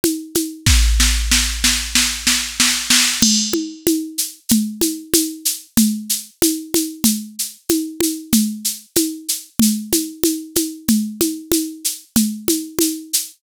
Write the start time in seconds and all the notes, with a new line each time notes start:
0.04 high conga, shaker
0.35 high conga, shaker
0.66 kick, snare
1.00 snare
1.31 snare
1.64 snare
1.95 snare
2.27 snare
2.60 snare
2.90 snare
3.22 crash, low conga, shaker
3.53 high conga
3.87 high conga, shaker
4.18 shaker
4.49 low conga, shaker
4.81 high conga, shaker
5.14 high conga, shaker
5.45 shaker
5.77 low conga, shaker
6.09 shaker
6.42 high conga, shaker
6.74 high conga, shaker
7.04 low conga, shaker
7.39 shaker
7.69 high conga, shaker
8.00 high conga, shaker
8.33 low conga, shaker
8.64 shaker
8.96 high conga, shaker
9.28 shaker
9.59 low conga, shaker
9.92 high conga, shaker
10.23 high conga, shaker
10.55 high conga, shaker
10.88 low conga, shaker
11.21 high conga, shaker
11.52 high conga, shaker
11.84 shaker
12.16 low conga, shaker
12.48 high conga, shaker
12.79 high conga, shaker
13.13 shaker